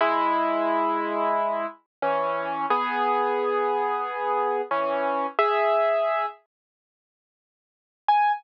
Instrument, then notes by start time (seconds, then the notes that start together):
acoustic grand piano
0.01 G#3 E4
2.02 E3 C#4
2.70 B3 G#4
4.71 E3 C#4
5.39 G#4 E5
8.08 G#5